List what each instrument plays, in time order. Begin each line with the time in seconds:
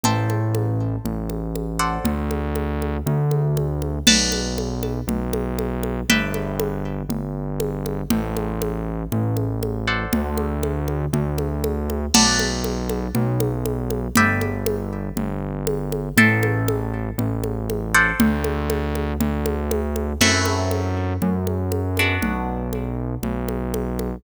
0.03 synth bass 1 A1, acoustic guitar (steel) A4 C5 E5 G5, low conga
0.30 high conga
0.55 high conga
1.05 synth bass 1 A1, low conga
1.30 high conga
1.55 high conga
1.79 acoustic guitar (steel) A4 C5 D5 F#5
2.04 synth bass 1 D2, low conga
2.31 high conga
2.56 high conga
2.82 high conga
3.06 synth bass 1 D2, low conga
3.31 high conga
3.57 high conga
3.82 high conga
4.07 synth bass 1 B1, acoustic guitar (steel) B4 D5 F#5 A5, crash, low conga
4.32 high conga
4.58 high conga
4.83 high conga
5.07 synth bass 1 B1, low conga
5.33 high conga
5.59 high conga
5.83 high conga
6.09 synth bass 1 G1, acoustic guitar (steel) B4 D5 E5 G5, low conga
6.34 high conga
6.60 high conga
7.09 synth bass 1 G1, low conga
7.60 high conga
7.86 high conga
8.10 synth bass 1 A1, acoustic guitar (steel) A4 C5 E5 G5, low conga
8.37 high conga
8.62 high conga
9.12 synth bass 1 A1, low conga
9.37 high conga
9.63 high conga
9.88 acoustic guitar (steel) A4 C5 D5 F#5
10.13 synth bass 1 D2, low conga
10.38 high conga
10.63 high conga
10.88 high conga
11.13 synth bass 1 D2, low conga
11.38 high conga
11.64 high conga
11.90 high conga
12.14 synth bass 1 B1, acoustic guitar (steel) B4 D5 F#5 A5, crash, low conga
12.39 high conga
12.64 high conga
12.89 high conga
13.15 synth bass 1 B1, low conga
13.40 high conga
13.66 high conga
13.90 high conga
14.15 synth bass 1 G1, acoustic guitar (steel) B4 D5 E5 G5, low conga
14.41 high conga
14.66 high conga
15.16 synth bass 1 G1, low conga
15.67 high conga
15.92 high conga
16.17 synth bass 1 A1, acoustic guitar (steel) A4 C5 E5 G5, low conga
16.43 high conga
16.68 high conga
17.18 synth bass 1 A1, low conga
17.44 high conga
17.70 high conga
17.94 acoustic guitar (steel) A4 C5 D5 F#5
18.20 synth bass 1 D2, low conga
18.44 high conga
18.70 high conga
18.95 high conga
19.20 synth bass 1 D2, low conga
19.46 high conga
19.71 high conga
19.96 high conga
20.21 synth bass 1 F#2, acoustic guitar (steel) A3 C4 E4 F#4, crash, low conga
20.45 high conga
20.71 high conga
21.22 synth bass 1 F#2, low conga
21.47 high conga
21.72 high conga
21.97 acoustic guitar (steel) B3 D4 F#4, high conga
22.22 synth bass 1 B1, low conga
22.73 high conga
23.23 synth bass 1 B1, low conga
23.48 high conga
23.74 high conga
23.99 high conga